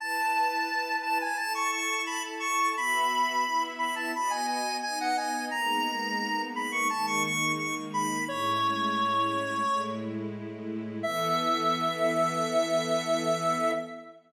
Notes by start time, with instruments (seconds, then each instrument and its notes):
0.00 string ensemble 1 E4 B4 A5, lead 1 (square) A5
1.02 lead 1 (square) A5
1.21 lead 1 (square) G#5
1.37 string ensemble 1 E4 A4 A5, lead 1 (square) A5
1.55 lead 1 (square) C#6
1.72 lead 1 (square) C#6
2.06 lead 1 (square) B5
2.40 lead 1 (square) C#6
2.76 string ensemble 1 B3 F#4 E5, lead 1 (square) B5
3.45 string ensemble 1 B3 E4 E5
3.79 lead 1 (square) B5
3.96 lead 1 (square) A5
4.15 string ensemble 1 B3 F#4 D#5, lead 1 (square) B5
4.30 lead 1 (square) G#5
4.48 lead 1 (square) G#5
4.82 string ensemble 1 B3 D#4 D#5, lead 1 (square) G#5
5.00 lead 1 (square) F#5
5.17 lead 1 (square) G#5
5.51 string ensemble 1 G#3 A#3 B3 D#4, lead 1 (square) A#5
6.55 lead 1 (square) B5
6.72 lead 1 (square) C#6
6.90 string ensemble 1 D#3 G#3 A#3 D#4, lead 1 (square) A5
7.07 lead 1 (square) C#6
7.24 lead 1 (square) C#6
7.58 lead 1 (square) C#6
7.94 lead 1 (square) B5
8.27 string ensemble 1 A2 G#3 C#4 E4, lead 1 (square) C#5
9.66 string ensemble 1 A2 G#3 A3 E4
11.03 string ensemble 1 E3 B3 A4, lead 1 (square) E5